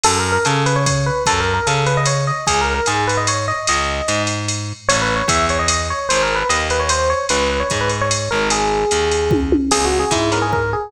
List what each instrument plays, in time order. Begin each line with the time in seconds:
0.04 electric bass (finger) F#2, electric piano 1 A4, crash, ride
0.19 electric piano 1 A#4
0.32 electric piano 1 A#4
0.45 electric bass (finger) C#3, electric piano 1 A4, hi-hat pedal, ride
0.66 electric piano 1 B4, ride
0.76 electric piano 1 C#5
0.86 electric piano 1 C#5, kick, ride
1.06 electric piano 1 B4
1.26 electric bass (finger) F#2, electric piano 1 A4, kick, ride
1.40 electric piano 1 A#4
1.54 electric piano 1 A#4
1.67 electric bass (finger) C#3, electric piano 1 A4, hi-hat pedal, ride
1.86 electric piano 1 B4, ride
1.97 electric piano 1 D#5
2.06 electric piano 1 C#5, ride
2.27 electric piano 1 D#5
2.47 electric bass (finger) C#2, electric piano 1 G#4, kick, ride
2.61 electric piano 1 A#4
2.74 electric piano 1 A#4
2.86 electric bass (finger) G#2, electric piano 1 G#4, hi-hat pedal, ride
3.07 electric piano 1 B4, ride
3.17 electric piano 1 D#5
3.27 electric piano 1 C#5, ride
3.48 electric piano 1 D#5
3.67 electric bass (finger) C#2, electric piano 1 D#5, ride
4.08 electric bass (finger) G#2, hi-hat pedal, ride
4.27 ride
4.48 ride
4.89 electric bass (finger) A1, electric piano 1 C#5, ride
5.02 electric piano 1 B4
5.16 electric piano 1 C#5
5.28 electric bass (finger) E2, electric piano 1 E5, kick, hi-hat pedal, ride
5.49 electric piano 1 C#5, ride
5.59 electric piano 1 D#5
5.68 electric piano 1 D#5, ride
5.90 electric piano 1 C#5
6.09 electric bass (finger) G#1, electric piano 1 C5, ride
6.23 electric piano 1 A#4
6.36 electric piano 1 B4
6.49 electric bass (finger) D#2, electric piano 1 D#5, hi-hat pedal, ride
6.70 electric piano 1 B4, ride
6.80 electric piano 1 C#5
6.89 electric piano 1 C5, ride
7.10 electric piano 1 C#5
7.29 electric bass (finger) C#2, electric piano 1 B4, ride
7.50 electric piano 1 B4
7.60 electric piano 1 C#5
7.70 electric bass (finger) G#2, kick, hi-hat pedal, ride
7.81 electric piano 1 B4
7.89 ride
8.01 electric piano 1 C#5
8.11 ride
8.31 electric bass (finger) G#1, electric piano 1 A#4
8.50 electric piano 1 G#4, ride
8.91 electric bass (finger) D#2, hi-hat pedal, ride
9.11 ride
9.31 kick, high tom
9.52 high tom
9.71 electric bass (finger) C#2, acoustic guitar (steel) B3 C#4 E4 G#4, electric piano 1 G#4, crash, ride
9.85 electric piano 1 F#4
10.00 electric piano 1 G#4
10.11 electric bass (finger) G#2, electric piano 1 E4, kick, hi-hat pedal, ride
10.32 acoustic guitar (steel) B3 C#4 E4 G#4, electric piano 1 A#4, ride
10.42 electric piano 1 G#4
10.53 electric piano 1 A#4, kick
10.73 electric piano 1 G#4